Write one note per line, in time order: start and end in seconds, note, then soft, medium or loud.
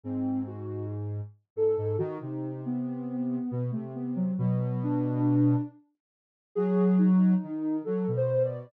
0.04 1.21 G#2 medium
0.04 0.44 C4 loud
0.47 0.86 F#4 medium
1.56 1.76 G#2 medium
1.56 1.96 A4 medium
1.77 1.97 G#2 medium
1.98 2.18 D#3 loud
1.98 2.18 F#4 medium
2.21 3.39 C3 medium
2.21 2.60 D#4 medium
2.66 3.64 B3 medium
3.51 3.71 B2 medium
3.72 4.32 C3 medium
3.72 3.91 A3 medium
3.95 4.14 B3 medium
4.16 4.35 F#3 loud
4.38 5.56 B2 loud
4.38 4.79 F#3 medium
4.83 5.61 D4 loud
6.55 7.34 F#3 loud
6.55 6.95 G#4 loud
6.98 7.76 D#4 medium
7.43 7.82 D#3 medium
7.85 8.06 F#3 medium
7.85 8.11 A4 medium
8.08 8.66 B2 medium
8.17 8.43 C5 medium
8.44 8.70 D5 medium